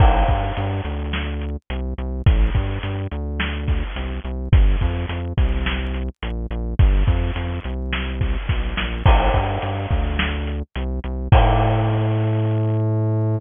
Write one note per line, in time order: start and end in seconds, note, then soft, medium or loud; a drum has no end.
0.00 0.24 A1 medium
0.00 kick loud
0.00 crash loud
0.28 0.52 G2 medium
0.28 kick medium
0.28 closed hi-hat medium
0.57 0.81 G2 medium
0.57 closed hi-hat medium
0.85 1.57 D2 medium
0.85 closed hi-hat medium
1.13 snare loud
1.41 closed hi-hat medium
1.70 1.94 C2 medium
1.70 closed hi-hat medium
1.98 2.22 C2 medium
1.98 closed hi-hat medium
2.26 2.50 A1 medium
2.26 kick loud
2.26 closed hi-hat loud
2.55 2.79 G2 medium
2.55 kick medium
2.55 closed hi-hat medium
2.83 3.07 G2 medium
2.83 closed hi-hat loud
3.11 3.84 D2 medium
3.11 closed hi-hat medium
3.40 snare loud
3.68 kick medium
3.68 closed hi-hat medium
3.96 4.20 C2 medium
3.96 closed hi-hat loud
4.24 4.48 C2 medium
4.24 closed hi-hat medium
4.52 4.76 G1 medium
4.52 kick loud
4.52 closed hi-hat loud
4.81 5.06 F2 medium
4.81 kick medium
4.81 closed hi-hat medium
5.09 5.33 F2 medium
5.09 closed hi-hat loud
5.37 6.09 C2 medium
5.37 kick medium
5.37 closed hi-hat medium
5.66 snare loud
5.94 closed hi-hat medium
6.23 6.47 A#1 medium
6.23 closed hi-hat loud
6.50 6.75 A#1 medium
6.50 closed hi-hat medium
6.79 7.04 G1 medium
6.79 kick loud
6.79 closed hi-hat medium
7.07 7.31 F2 medium
7.07 kick medium
7.07 closed hi-hat medium
7.35 7.60 F2 medium
7.35 closed hi-hat loud
7.64 8.37 C2 medium
7.64 closed hi-hat medium
7.93 snare loud
8.21 kick medium
8.21 closed hi-hat medium
8.49 8.74 B1 medium
8.49 kick medium
8.49 snare medium
8.77 9.03 A#1 medium
8.77 snare loud
9.06 9.30 A1 medium
9.06 kick loud
9.06 crash loud
9.34 9.58 G2 medium
9.34 kick medium
9.34 closed hi-hat medium
9.62 9.87 G2 medium
9.62 closed hi-hat medium
9.90 10.63 D2 medium
9.90 kick medium
9.90 closed hi-hat medium
10.19 snare loud
10.47 closed hi-hat medium
10.75 11.00 C2 medium
10.75 closed hi-hat loud
11.04 11.28 C2 medium
11.04 closed hi-hat medium
11.32 13.39 A2 loud
11.32 kick loud
11.32 crash loud